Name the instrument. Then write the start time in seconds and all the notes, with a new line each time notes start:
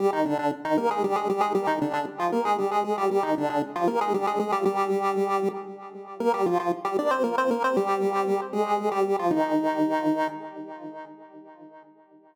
lead 1 (square)
0.00 G3 G4
0.13 D#3 D#4
0.25 D3 D4
0.39 D3 D4
0.65 D#3 D#4
0.78 A#3 A#4
0.91 G#3 G#4
1.04 G3 G4
1.16 G#3 G#4
1.30 G3 G4
1.41 G#3 G#4
1.55 G3 G4
1.67 D#3 D#4
1.81 D3 D4
1.93 D3 D4
2.19 F3 F4
2.32 A#3 A#4
2.45 G#3 G#4
2.58 G3 G4
2.71 G#3 G#4
2.84 G#3 G#4
2.98 G3 G4
3.11 G3 G4
3.23 D#3 D#4
3.38 D3 D4
3.50 D3 D4
3.76 F3 F4
3.88 A#3 A#4
4.01 G#3 G#4
4.14 G3 G4
4.27 G#3 G#4
4.39 G#3 G#4
4.52 G3 G4
4.65 G3 G4
6.20 A#3 A#4
6.34 G3 G4
6.46 F3 F4
6.60 F3 F4
6.85 G3 G4
6.99 D4 D5
7.11 C4 C5
7.24 A#3 A#4
7.38 C4 C5
7.51 A#3 A#4
7.64 C4 C5
7.77 G3 G4
8.53 G#3 G#4
8.92 G3 G4
9.19 F3 F4
9.31 D#3 D#4